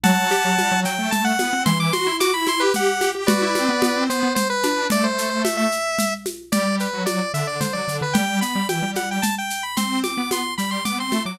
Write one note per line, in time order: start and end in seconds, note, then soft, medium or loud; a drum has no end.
0.03 0.30 F#3 loud
0.03 0.80 F#5 medium
0.03 0.80 A5 loud
0.03 low conga loud
0.03 shaker medium
0.31 0.44 G4 loud
0.31 shaker medium
0.45 0.57 F#3 medium
0.58 0.71 G3 medium
0.58 high conga medium
0.58 shaker medium
0.71 0.84 F#3 loud
0.85 0.98 F#3 medium
0.85 1.10 G5 medium
0.85 shaker medium
0.98 1.38 A3 medium
1.11 1.24 A5 medium
1.11 low conga medium
1.11 shaker medium
1.24 1.63 F#5 medium
1.39 1.52 B3 medium
1.39 high conga medium
1.39 shaker medium
1.53 1.66 C4 medium
1.66 1.91 E3 loud
1.66 1.78 C6 medium
1.66 low conga loud
1.66 shaker medium
1.80 1.93 D6 medium
1.93 2.06 F#4 medium
1.93 2.16 C6 medium
1.93 high conga medium
1.93 shaker medium
2.07 2.19 E4 medium
2.20 2.33 F#4 loud
2.20 2.33 D6 medium
2.20 high conga medium
2.20 shaker medium
2.34 2.47 E4 medium
2.34 2.46 B5 medium
2.47 2.60 E4 loud
2.47 2.61 C6 medium
2.47 high conga medium
2.47 shaker medium
2.60 2.98 G4 loud
2.60 2.73 B4 medium
2.74 3.10 F#5 medium
2.74 low conga medium
2.74 shaker medium
3.01 3.14 G4 medium
3.01 high conga medium
3.01 shaker medium
3.15 3.28 G4 medium
3.27 3.41 F#4 loud
3.27 4.04 B4 medium
3.27 4.04 D5 medium
3.27 low conga loud
3.27 shaker medium
3.42 3.55 E4 loud
3.55 3.68 C4 medium
3.55 high conga medium
3.55 shaker medium
3.69 3.82 B3 medium
3.82 3.95 B3 loud
3.82 high conga loud
3.82 shaker medium
3.96 4.09 C4 medium
4.09 4.22 B3 medium
4.09 4.33 C5 medium
4.09 shaker medium
4.23 4.36 B3 medium
4.35 4.48 C5 medium
4.35 low conga medium
4.35 shaker medium
4.50 4.87 B4 medium
4.63 4.86 D4 medium
4.63 high conga medium
4.63 shaker medium
4.90 5.67 A3 medium
4.90 5.04 D5 loud
4.90 low conga loud
4.90 shaker medium
5.04 5.29 C5 medium
5.18 shaker medium
5.30 5.42 C5 medium
5.44 5.57 E5 medium
5.44 high conga medium
5.44 shaker medium
5.57 6.14 E5 medium
5.72 shaker medium
5.99 low conga medium
5.99 shaker medium
6.26 high conga medium
6.26 shaker medium
6.52 6.88 G3 medium
6.52 6.76 D5 medium
6.52 low conga loud
6.52 shaker medium
6.80 7.03 B4 medium
6.80 shaker medium
6.93 7.06 F#3 medium
7.06 7.19 F#3 medium
7.06 7.32 D5 medium
7.06 high conga medium
7.06 shaker medium
7.34 7.57 D3 medium
7.34 7.47 E5 medium
7.34 shaker medium
7.47 7.60 D5 medium
7.60 7.73 D3 medium
7.60 7.73 C5 medium
7.60 low conga medium
7.60 shaker medium
7.73 7.87 F#3 medium
7.73 7.97 D5 medium
7.88 8.00 D3 medium
7.88 shaker medium
8.01 8.14 D3 medium
8.01 8.15 B4 medium
8.13 8.40 G3 medium
8.13 8.39 G5 medium
8.13 low conga loud
8.13 shaker medium
8.41 8.55 B3 medium
8.41 8.67 B5 medium
8.41 shaker medium
8.55 8.68 G3 medium
8.69 8.82 E3 medium
8.69 8.91 G5 medium
8.69 high conga medium
8.69 shaker medium
8.82 9.18 G3 medium
8.95 9.09 F#5 medium
8.95 high conga medium
8.95 shaker medium
9.11 9.24 G5 medium
9.22 9.35 A5 medium
9.22 low conga medium
9.22 shaker medium
9.38 9.63 G5 medium
9.50 shaker medium
9.63 9.76 B5 medium
9.76 10.10 C4 medium
9.76 9.99 C6 medium
9.76 low conga medium
9.76 shaker medium
10.04 10.29 D6 medium
10.04 high conga medium
10.04 shaker medium
10.17 10.30 B3 medium
10.31 10.44 B3 medium
10.31 10.54 C6 medium
10.31 high conga medium
10.31 shaker medium
10.58 10.82 G3 medium
10.58 10.70 B5 medium
10.58 shaker medium
10.71 10.84 C6 medium
10.85 10.98 B3 medium
10.85 10.98 D6 medium
10.85 low conga medium
10.85 shaker medium
10.98 11.11 C4 medium
10.98 11.23 C6 medium
11.12 11.25 A3 medium
11.12 high conga medium
11.12 shaker medium
11.25 11.38 F#3 medium
11.25 11.39 D6 medium